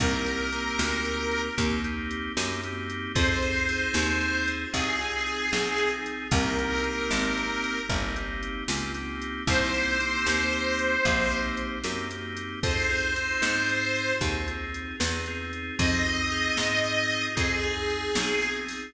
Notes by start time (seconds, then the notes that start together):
0.00 C2 A#3 C4 D#4 G4 A#4, kick, closed hi-hat
0.26 A#3 C4 D#4 G4, closed hi-hat
0.52 A#3 C4 D#4 G4, closed hi-hat
0.79 D2, snare
1.05 closed hi-hat
1.31 closed hi-hat
1.57 D#2 A#3 C4 D#4 G4, kick, closed hi-hat
1.84 A#3 C4 D#4 G4, closed hi-hat
2.11 closed hi-hat
2.37 F#2 A#3 C4 D#4 G4, snare
2.63 A#3 C4 D#4 G4, closed hi-hat
2.90 closed hi-hat
3.15 F2 C4 D#4 F4 G#4 C5, kick, closed hi-hat
3.42 C4 D#4 F4 G#4, closed hi-hat
3.69 C4 D#4 F4 G#4, closed hi-hat
3.94 D#2, snare
4.21 closed hi-hat
4.48 closed hi-hat
4.72 C2 C4 D#4 F4 G#4, kick, closed hi-hat
5.00 C4 D#4 F4 G#4, closed hi-hat
5.26 closed hi-hat
5.52 B1 C4 D#4 F4 G#4, snare
5.78 C4 D#4 F4 G#4, closed hi-hat
6.06 closed hi-hat
6.31 C2 A#3 C4 D#4 G4 A#4, kick, closed hi-hat
6.58 A#3 C4 D#4 G4, closed hi-hat
6.82 A#3 C4 D#4 G4, closed hi-hat
7.11 G#1, snare
7.38 closed hi-hat
7.64 closed hi-hat
7.89 G1 A#3 C4 D#4 G4, kick, closed hi-hat
8.15 A#3 C4 D#4 G4, closed hi-hat
8.43 closed hi-hat
8.68 C#2 A#3 C4 D#4 G4, snare
8.94 A#3 C4 D#4 G4, closed hi-hat
9.22 closed hi-hat
9.47 C2 A#3 C4 D#4 G4 C5, kick, closed hi-hat
9.74 A#3 C4 D#4 G4, closed hi-hat
9.99 A#3 C4 D#4 G4, closed hi-hat
10.26 D#2, snare
10.53 closed hi-hat
10.79 closed hi-hat
11.04 A#1 A#3 C4 D#4 G4, kick, closed hi-hat
11.30 A#3 C4 D#4 G4, closed hi-hat
11.57 closed hi-hat
11.84 F#2 A#3 C4 D#4 G4, snare
12.11 A#3 C4 D#4 G4, closed hi-hat
12.37 closed hi-hat
12.63 F2 C4 D#4 F4 G#4 C5, kick, closed hi-hat
12.89 C4 D#4 F4 G#4, closed hi-hat
13.16 C4 D#4 F4 G#4, closed hi-hat
13.42 G#2, snare
13.69 closed hi-hat
13.95 closed hi-hat
14.21 D#2 C4 D#4 F4 G#4, kick, closed hi-hat
14.47 C4 D#4 F4 G#4, closed hi-hat
14.74 closed hi-hat
15.00 E2 C4 D#4 F4 G#4, snare
15.26 C4 D#4 F4 G#4, closed hi-hat
15.53 closed hi-hat
15.79 F2 C4 D#4 F4 G#4 D#5, kick, closed hi-hat
16.06 C4 D#4 F4 G#4, closed hi-hat
16.31 C4 D#4 F4 G#4, closed hi-hat
16.57 G#2, snare
16.84 closed hi-hat
17.10 closed hi-hat
17.35 F2 C4 D#4 F4 G#4, kick, closed hi-hat
17.63 C4 D#4 F4 G#4, closed hi-hat
17.90 closed hi-hat
18.15 B1 C4 D#4 F4 G#4, snare
18.42 C4 D#4 F4 G#4, closed hi-hat
18.68 open hi-hat